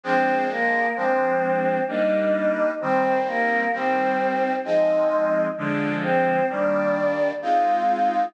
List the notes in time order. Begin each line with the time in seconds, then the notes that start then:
0.03 F3 G#3 C4 D4 C5
0.50 A#3 A#4
0.96 F3 G#3 C4 D4 C5
1.88 G3 A#3 D4 D#4 D#5
2.81 D#3 G3 C4 C5
3.26 A#3 A#4
3.73 D#3 G3 C4 C5
4.65 F3 G#3 C4 D#4 D#5
5.58 D3 F3 G#3 D4 D5
6.03 C4 C5
6.49 D#3 G3 A#3 D4 D5
7.42 G#3 C4 D#4 F4 F5